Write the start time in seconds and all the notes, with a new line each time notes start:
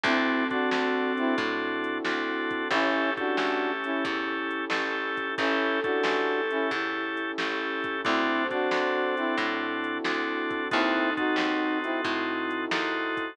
0.03 D2 C4 D4 E4 F#4 A4, kick, closed hi-hat
0.50 C4 D4 F#4 A4, kick, closed hi-hat
0.71 D2 C4 D4 F#4 A4, snare
1.17 C4 E4, closed hi-hat
1.38 A2 E4, kick, closed hi-hat
1.84 closed hi-hat
2.05 D2 C4 D4 F#4 A4, snare
2.51 kick, closed hi-hat
2.70 A1 C#4 E4 G4 A4, kick, closed hi-hat
3.17 C#4 D4 E4 F#4 G4 A4, kick, closed hi-hat
3.37 A1 C#4 E4 G4 A4, snare
3.84 C#4 E4, closed hi-hat
4.04 E2 E4, kick, closed hi-hat
4.51 closed hi-hat
4.70 A1 C#4 E4 G4 A4, snare
5.17 kick, closed hi-hat
5.37 A1 C#4 E4 G4 A4, kick, closed hi-hat
5.84 C#4 D4 E4 F#4 G4 A4, kick, closed hi-hat
6.03 A1 C#4 E4 G4 A4, snare
6.50 C#4 E4, closed hi-hat
6.71 E2 E4, kick, closed hi-hat
7.17 closed hi-hat
7.38 A1 C#4 E4 G4 A4, snare
7.84 kick, closed hi-hat
8.04 D2 C4 D4 E4 F#4 A4 C5, kick, closed hi-hat
8.51 C4 D4 F#4 A4, kick, closed hi-hat
8.71 D2 C4 D4 F#4 A4, snare
9.17 C4 E4, closed hi-hat
9.37 A2 E4, kick, closed hi-hat
9.84 closed hi-hat
10.04 D2 C4 D4 F#4 A4, snare
10.51 kick, closed hi-hat
10.71 D#2 C4 D#4 E4 F#4 A4, kick, closed hi-hat
11.17 C4 D#4 F#4 A4, kick, closed hi-hat
11.36 D#2 C4 D#4 F#4 A4, snare
11.83 C4 E4, closed hi-hat
12.04 A2 E4, kick, closed hi-hat
12.51 closed hi-hat
12.71 D#2 C4 D#4 F#4 A4, snare
13.17 kick, closed hi-hat